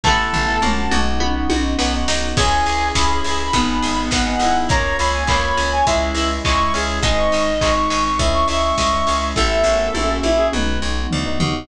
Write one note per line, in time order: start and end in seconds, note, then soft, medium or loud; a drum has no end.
0.04 0.29 A1 medium
0.04 0.61 A3 medium
0.04 0.39 A3 medium
0.04 0.57 A3 medium
0.04 0.61 B3 loud
0.04 0.39 B3 medium
0.04 0.57 B3 medium
0.04 0.61 E4 medium
0.04 0.39 E4 medium
0.04 0.60 A4 loud
0.04 1.00 A5 loud
0.04 kick medium
0.04 floor tom medium
0.09 0.57 E4 medium
0.33 0.58 A1 medium
0.33 floor tom medium
0.48 0.59 A3 medium
0.48 0.59 B3 medium
0.48 0.59 E4 medium
0.62 0.87 A#1 medium
0.62 0.90 A#3 loud
0.62 1.18 A#3 medium
0.62 1.20 A#3 medium
0.62 0.90 C#4 loud
0.62 1.20 C#4 medium
0.62 0.90 F#4 loud
0.62 1.20 F#4 medium
0.62 mid tom loud
0.91 1.45 B1 medium
0.91 1.32 B3 medium
0.91 1.32 D#4 loud
0.91 1.19 F#4 medium
0.91 1.32 F#4 loud
0.91 mid tom medium
1.20 1.78 B3 medium
1.20 1.78 D#4 medium
1.20 1.78 F#4 medium
1.20 high tom medium
1.35 1.47 B3 medium
1.35 1.47 D#4 medium
1.35 1.47 F#4 medium
1.50 1.74 B1 medium
1.50 1.73 B3 medium
1.50 1.73 D#4 medium
1.50 2.33 F#4 medium
1.50 1.73 F#4 medium
1.50 high tom loud
1.78 2.04 B1 medium
1.78 2.34 B3 medium
1.78 1.90 B3 medium
1.78 2.37 B3 medium
1.78 1.90 D#4 medium
1.78 1.90 F#4 medium
1.78 2.37 F#4 medium
1.78 2.37 B4 medium
1.78 snare loud
1.93 2.28 B3 medium
1.93 2.28 D#4 medium
1.93 2.28 F#4 medium
2.08 2.33 B1 medium
2.08 2.36 D#4 medium
2.08 snare loud
2.36 2.62 C#2 medium
2.36 3.52 C#4 medium
2.36 2.84 C#4 medium
2.36 2.95 C#4 medium
2.36 3.52 E4 medium
2.36 2.84 E4 medium
2.36 3.43 G#4 loud
2.36 3.52 G#4 medium
2.36 2.84 G#4 medium
2.36 2.88 G#5 loud
2.36 kick loud
2.36 crash loud
2.66 2.91 C#2 medium
2.66 3.50 G#4 medium
2.66 open hi-hat medium
2.95 3.20 C#2 medium
2.95 3.50 C#4 medium
2.95 3.42 C#4 medium
2.95 3.42 E4 medium
2.95 3.42 G#4 medium
2.95 3.99 B5 medium
2.95 kick medium
2.95 snare loud
3.24 3.50 C#2 medium
3.24 3.52 E4 medium
3.24 open hi-hat loud
3.53 3.78 G#1 medium
3.53 4.00 B3 medium
3.53 4.26 B3 medium
3.53 4.11 B3 medium
3.53 4.69 B3 medium
3.53 4.00 D#4 medium
3.53 4.69 D#4 medium
3.53 4.00 G#4 medium
3.53 4.69 G#4 medium
3.53 kick medium
3.53 closed hi-hat loud
3.82 4.08 G#1 medium
3.82 4.65 G#4 soft
3.82 open hi-hat medium
4.11 4.36 G#1 medium
4.11 4.67 B3 medium
4.11 4.66 F#5 loud
4.11 kick medium
4.11 snare loud
4.26 4.38 B3 medium
4.26 4.38 D#4 medium
4.26 4.38 G#4 medium
4.39 4.64 G#1 medium
4.39 4.64 B3 medium
4.39 4.68 D#4 medium
4.39 4.64 D#4 medium
4.39 4.70 E4 medium
4.39 4.64 G#4 medium
4.39 open hi-hat medium
4.69 4.94 C#2 medium
4.69 5.17 A#3 medium
4.69 5.28 A#3 medium
4.69 5.86 A#3 medium
4.69 5.17 C#4 medium
4.69 5.86 C#4 medium
4.69 5.17 F4 medium
4.69 5.86 F4 medium
4.69 4.96 C#5 loud
4.69 4.97 A#5 loud
4.69 kick loud
4.69 closed hi-hat loud
4.98 5.24 C#2 medium
4.98 5.82 F4 soft
4.98 5.22 C#5 medium
4.98 5.13 B5 medium
4.98 open hi-hat medium
5.14 5.28 G#5 medium
5.27 5.52 C#2 medium
5.27 5.75 A#3 medium
5.27 5.84 A#3 medium
5.27 5.75 C#4 medium
5.27 5.75 F4 medium
5.27 5.85 C#5 loud
5.27 5.42 B5 medium
5.27 kick loud
5.27 clap loud
5.43 5.70 B5 medium
5.57 5.82 C#2 medium
5.57 5.85 C#4 medium
5.57 open hi-hat medium
5.72 5.86 G#5 medium
5.87 6.12 C#2 medium
5.87 6.33 G#3 medium
5.87 6.44 G#3 medium
5.87 7.02 G#3 medium
5.87 6.33 C#4 loud
5.87 7.03 C#4 medium
5.87 6.29 E4 medium
5.87 6.33 E4 medium
5.87 7.03 E4 medium
5.87 6.38 E5 medium
5.87 kick medium
5.87 closed hi-hat loud
6.14 6.39 C#2 medium
6.14 6.99 E4 medium
6.14 open hi-hat medium
6.45 6.70 C#2 medium
6.45 7.00 G#3 medium
6.45 6.73 E4 medium
6.45 6.72 C#6 loud
6.45 kick medium
6.45 clap loud
6.59 6.71 G#3 medium
6.59 6.71 C#4 medium
6.59 6.71 E4 medium
6.74 7.00 C#2 medium
6.74 6.97 G#3 medium
6.74 7.01 C#4 medium
6.74 6.97 C#4 medium
6.74 6.97 E4 medium
6.74 6.99 G#4 medium
6.74 open hi-hat medium
7.02 7.27 G#1 medium
7.02 8.18 G#3 medium
7.02 7.50 G#3 medium
7.02 7.61 G#3 medium
7.02 8.18 C4 medium
7.02 7.50 C4 medium
7.02 8.18 D#4 loud
7.02 7.50 D#4 medium
7.02 7.72 D#5 medium
7.02 kick loud
7.02 closed hi-hat loud
7.18 7.42 C#6 medium
7.32 7.58 G#1 medium
7.32 8.15 D#4 medium
7.32 open hi-hat medium
7.61 7.87 G#1 medium
7.61 7.90 G#3 medium
7.61 8.08 G#3 medium
7.61 8.08 C4 medium
7.61 8.08 D#4 medium
7.61 7.75 C#6 medium
7.61 kick loud
7.61 clap loud
7.76 8.04 C#6 medium
7.90 8.16 G#1 medium
7.90 8.77 G#3 medium
7.90 open hi-hat medium
8.05 8.19 C#6 medium
8.18 8.44 C#2 medium
8.18 8.66 G#3 medium
8.18 9.35 G#3 medium
8.18 8.66 C#4 medium
8.18 9.35 C#4 medium
8.18 8.66 E4 medium
8.18 9.35 E4 medium
8.18 8.46 E5 medium
8.18 kick loud
8.18 closed hi-hat loud
8.34 8.48 C#6 loud
8.48 8.72 C#2 medium
8.48 9.32 E4 medium
8.48 8.76 E5 loud
8.48 8.62 C#6 medium
8.48 open hi-hat medium
8.63 9.25 C#6 medium
8.77 9.03 C#2 medium
8.77 9.33 G#3 medium
8.77 9.29 E5 medium
8.77 kick medium
8.77 snare loud
8.92 9.04 G#3 medium
8.92 9.04 C#4 medium
8.92 9.04 E4 medium
9.07 9.33 C#2 medium
9.07 9.30 G#3 medium
9.07 9.30 C#4 medium
9.07 9.35 C#4 medium
9.07 9.30 E4 medium
9.07 open hi-hat medium
9.35 9.62 A1 medium
9.35 9.64 A3 medium
9.35 9.94 A3 medium
9.35 9.64 B3 medium
9.35 9.94 B3 medium
9.35 9.64 E4 medium
9.35 9.94 E4 medium
9.35 10.14 A4 loud
9.35 10.47 E5 loud
9.35 kick medium
9.35 snare medium
9.63 9.88 A1 medium
9.63 10.41 A#3 medium
9.63 10.41 C#4 medium
9.63 10.41 F#4 loud
9.63 snare medium
9.94 10.19 A#1 medium
9.94 10.53 A#3 medium
9.94 10.53 C#4 medium
9.94 10.52 F#4 medium
9.94 high tom medium
10.23 10.48 A#1 medium
10.23 10.38 E4 loud
10.23 high tom medium
10.37 10.50 G#4 loud
10.52 10.78 B1 medium
10.52 10.99 B3 medium
10.52 11.67 B3 medium
10.52 10.99 D#4 medium
10.52 11.67 D#4 medium
10.52 10.99 F#4 medium
10.52 11.67 F#4 medium
10.52 10.80 B4 medium
10.52 mid tom medium
10.82 11.07 B1 medium
11.11 11.39 D2 medium
11.11 floor tom loud
11.25 11.37 B3 medium
11.25 11.37 D#4 medium
11.25 11.37 F#4 medium
11.40 11.66 D#2 medium
11.40 11.63 B3 medium
11.40 11.63 D#4 medium
11.40 11.63 F#4 medium
11.40 floor tom loud